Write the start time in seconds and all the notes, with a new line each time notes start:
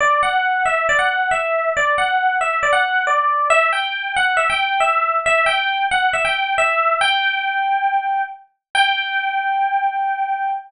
0.00 D5
0.23 F#5
0.66 E5
0.89 D5
0.99 F#5
1.31 E5
1.77 D5
1.98 F#5
2.41 E5
2.63 D5
2.73 F#5
3.07 D5
3.50 E5
3.73 G5
4.16 F#5
4.37 E5
4.50 G5
4.80 E5
5.26 E5
5.46 G5
5.91 F#5
6.13 E5
6.25 G5
6.58 E5
7.01 G5
8.75 G5